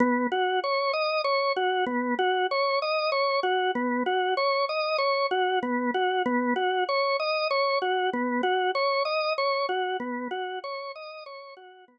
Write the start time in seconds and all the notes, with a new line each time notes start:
0.00 B3
0.32 F#4
0.64 C#5
0.93 D#5
1.24 C#5
1.56 F#4
1.86 B3
2.18 F#4
2.51 C#5
2.82 D#5
3.12 C#5
3.43 F#4
3.75 B3
4.06 F#4
4.37 C#5
4.69 D#5
4.98 C#5
5.31 F#4
5.62 B3
5.94 F#4
6.26 B3
6.56 F#4
6.89 C#5
7.19 D#5
7.50 C#5
7.82 F#4
8.13 B3
8.43 F#4
8.75 C#5
9.05 D#5
9.38 C#5
9.69 F#4
10.00 B3
10.31 F#4
10.64 C#5
10.95 D#5
11.26 C#5
11.57 F#4
11.88 B3